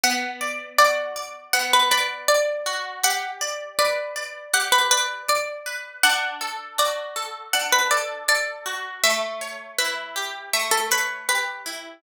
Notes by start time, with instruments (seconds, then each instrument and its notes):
0.04 orchestral harp B3, pizzicato strings F#5
0.41 orchestral harp D5
0.78 orchestral harp F#4, pizzicato strings D5
1.16 orchestral harp D5
1.53 orchestral harp B3, pizzicato strings F#5
1.73 pizzicato strings B4
1.91 pizzicato strings B4, orchestral harp D5
2.28 pizzicato strings D5, orchestral harp D5
2.66 orchestral harp F#4
3.04 orchestral harp G4, pizzicato strings F#5
3.41 orchestral harp D5
3.79 orchestral harp B4, pizzicato strings D5
4.16 orchestral harp D5
4.54 orchestral harp G4, pizzicato strings F#5
4.72 pizzicato strings B4
4.91 pizzicato strings B4, orchestral harp D5
5.28 orchestral harp D5, pizzicato strings D5
5.66 orchestral harp B4
6.03 orchestral harp D4, pizzicato strings F#5
6.41 orchestral harp A4
6.78 orchestral harp F#4, pizzicato strings D5
7.16 orchestral harp A4
7.53 orchestral harp D4, pizzicato strings F#5
7.73 pizzicato strings B4
7.91 orchestral harp A4, pizzicato strings D5
8.28 orchestral harp A4, pizzicato strings D5
8.66 orchestral harp F#4
9.04 orchestral harp A3, pizzicato strings E5
9.41 orchestral harp C#5
9.78 orchestral harp E4, pizzicato strings B4
10.16 orchestral harp G4
10.53 orchestral harp A3, pizzicato strings E5
10.71 pizzicato strings A4
10.91 pizzicato strings B4, orchestral harp C#5
11.29 orchestral harp G4, pizzicato strings B4
11.66 orchestral harp E4